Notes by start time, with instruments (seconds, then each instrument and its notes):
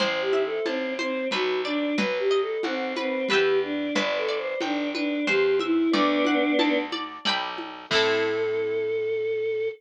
0.00 electric bass (finger) A1, acoustic guitar (steel) C5, choir aahs C5, low conga
0.21 choir aahs G4
0.33 acoustic guitar (steel) E5, high conga
0.46 choir aahs A4
0.66 electric bass (finger) A1, choir aahs C4, acoustic guitar (steel) A5, high conga
0.99 choir aahs C4, acoustic guitar (steel) C5, high conga
1.31 electric bass (finger) B1, choir aahs F#4, acoustic guitar (steel) B4, low conga
1.65 choir aahs D4, acoustic guitar (steel) D5
1.97 electric bass (finger) B1, choir aahs B4, acoustic guitar (steel) B4, low conga
2.19 choir aahs G4
2.31 acoustic guitar (steel) D#5
2.42 choir aahs A4
2.63 electric bass (finger) B1, choir aahs C4, acoustic guitar (steel) F#5, high conga
2.96 choir aahs C4, acoustic guitar (steel) B4, high conga
3.27 electric bass (finger) E2, choir aahs G4, acoustic guitar (steel) B4, low conga
3.32 acoustic guitar (steel) E5 G5
3.63 choir aahs D4
3.95 electric bass (finger) G1, acoustic guitar (steel) B4, choir aahs D5, low conga
4.18 choir aahs A4
4.28 acoustic guitar (steel) D5
4.38 choir aahs C5
4.61 electric bass (finger) G1, choir aahs D4, acoustic guitar (steel) G5, high conga
4.95 choir aahs D4, acoustic guitar (steel) B4, high conga
5.27 electric bass (finger) E2, choir aahs G4, acoustic guitar (steel) C5, low conga
5.59 choir aahs E4, acoustic guitar (steel) E5, high conga
5.91 electric bass (finger) D2, choir aahs B3 D4, acoustic guitar (steel) D5, low conga
6.25 acoustic guitar (steel) F#5, high conga
6.59 electric bass (finger) D2, acoustic guitar (steel) A5, high conga
6.92 acoustic guitar (steel) D5, high conga
7.25 electric bass (finger) B1, acoustic guitar (steel) D5 G5 B5, low conga
7.58 high conga
7.90 electric bass (finger) A2, acoustic guitar (steel) C4 E4, choir aahs A4, kick, crash
7.95 acoustic guitar (steel) A4